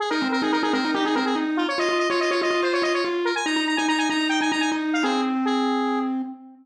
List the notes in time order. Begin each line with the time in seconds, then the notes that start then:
0.00 G#4
0.10 D#4 A#4
0.21 C4
0.32 A#4
0.42 D#4 G#4
0.52 D#4 A#4
0.63 D#4 G#4
0.73 C4 A#4
0.85 D#4
0.94 D#4 G4
1.05 D#4 G#4
1.15 C4 A#4
1.25 G#4
1.35 D#4
1.57 F4
1.68 C#5
1.78 F4 D#5
1.89 F4
1.99 D#5
2.10 F4 C#5
2.19 F4 D#5
2.31 F4 C#5
2.42 F4 D#5
2.51 F4
2.62 F4 C5
2.73 F4 C#5
2.82 F4 D#5
2.94 C#5
3.04 F4
3.25 A#4
3.35 G#5
3.45 D#4 A#5
3.56 D#4
3.67 A#5
3.77 D#4 G#5
3.88 D#4 A#5
3.98 D#4 G#5
4.10 D#4 A#5
4.20 D#4
4.29 D#4 G5
4.41 D#4 G#5
4.51 D#4 A#5
4.60 G#5
4.72 D#4
4.93 F5
5.03 C4 G#4
5.45 G#4